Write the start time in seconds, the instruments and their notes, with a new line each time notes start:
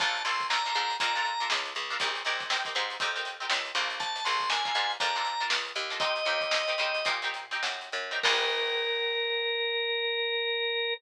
0.00 electric bass (finger) A#1, pizzicato strings D4 F4 A4 A#4, drawbar organ A5, kick, closed hi-hat
0.15 snare, closed hi-hat
0.25 electric bass (finger) A#1, pizzicato strings D4 F4 A4 A#4, drawbar organ C6, closed hi-hat
0.40 kick, closed hi-hat
0.50 pizzicato strings D4 F4 A4 A#4, drawbar organ A#5, snare
0.66 pizzicato strings D4 F4 A4 A#4, closed hi-hat
0.75 electric bass (finger) G#2, pizzicato strings D4 F4 A4 A#4, closed hi-hat
0.90 closed hi-hat
1.00 electric bass (finger) F2, pizzicato strings D4 F4 A4 A#4, drawbar organ A#5, kick, closed hi-hat
1.15 pizzicato strings D4 F4 A4 A#4, closed hi-hat
1.25 closed hi-hat
1.40 pizzicato strings D4 F4 A4 A#4, closed hi-hat
1.50 electric bass (finger) C#2, snare
1.65 snare, closed hi-hat
1.75 electric bass (finger) C#2, closed hi-hat
1.90 pizzicato strings D4 F4 A4 A#4, closed hi-hat
2.00 electric bass (finger) A#1, pizzicato strings C4 D#4 G4 A#4, kick, closed hi-hat
2.15 snare, closed hi-hat
2.25 electric bass (finger) A#1, pizzicato strings C4 D#4 G4 A#4, snare, closed hi-hat
2.40 kick, closed hi-hat
2.50 pizzicato strings C4 D#4 G4 A#4, snare
2.65 pizzicato strings C4 D#4 G4 A#4, kick, closed hi-hat
2.75 electric bass (finger) G#2, pizzicato strings C4 D#4 G4 A#4, closed hi-hat
2.90 closed hi-hat
3.00 electric bass (finger) F2, pizzicato strings C4 D#4 G4 A#4, kick, closed hi-hat
3.15 pizzicato strings C4 D#4 G4 A#4, closed hi-hat
3.25 closed hi-hat
3.40 pizzicato strings C4 D#4 G4 A#4, closed hi-hat
3.50 electric bass (finger) C#2, snare
3.65 closed hi-hat
3.75 electric bass (finger) A#1, pizzicato strings D4 F4 A4 A#4, closed hi-hat
3.90 closed hi-hat
4.00 drawbar organ A5, kick, closed hi-hat
4.16 closed hi-hat
4.25 electric bass (finger) A#1, pizzicato strings D4 F4 A4 A#4, drawbar organ C6, closed hi-hat
4.40 kick, closed hi-hat
4.50 pizzicato strings D4 F4 A4 A#4, drawbar organ G#5, snare
4.65 pizzicato strings D4 F4 A4 A#4, kick, closed hi-hat
4.75 electric bass (finger) G#2, pizzicato strings D4 F4 A4 A#4, closed hi-hat
4.90 closed hi-hat
5.00 electric bass (finger) F2, pizzicato strings D4 F4 A4 A#4, drawbar organ A#5, kick, closed hi-hat
5.15 pizzicato strings D4 F4 A4 A#4, closed hi-hat
5.25 snare, closed hi-hat
5.40 pizzicato strings D4 F4 A4 A#4, closed hi-hat
5.50 electric bass (finger) C#2, snare
5.65 closed hi-hat
5.75 electric bass (finger) D#2, closed hi-hat
5.90 pizzicato strings D4 F4 A4 A#4, closed hi-hat
6.00 pizzicato strings C4 D#4 G4 A#4, drawbar organ D#5, kick, closed hi-hat
6.16 snare, closed hi-hat
6.25 electric bass (finger) D#2, pizzicato strings C4 D#4 G4 A#4, closed hi-hat
6.41 kick, closed hi-hat
6.51 pizzicato strings C4 D#4 G4 A#4, snare
6.68 pizzicato strings C4 D#4 G4 A#4, closed hi-hat
6.78 electric bass (finger) C#3, pizzicato strings C4 D#4 G4 A#4, closed hi-hat
6.94 closed hi-hat
7.05 electric bass (finger) A#2, pizzicato strings C4 D#4 G4 A#4, kick, closed hi-hat
7.22 pizzicato strings C4 D#4 G4 A#4, closed hi-hat
7.34 closed hi-hat
7.51 pizzicato strings C4 D#4 G4 A#4, snare, closed hi-hat
7.63 electric bass (finger) F#2, snare
7.81 closed hi-hat
7.92 electric bass (finger) F#2, closed hi-hat
8.11 pizzicato strings C4 D#4 G4 A#4, closed hi-hat
8.23 electric bass (finger) A#1, pizzicato strings D4 F4 A4 A#4, drawbar organ A#4, kick, crash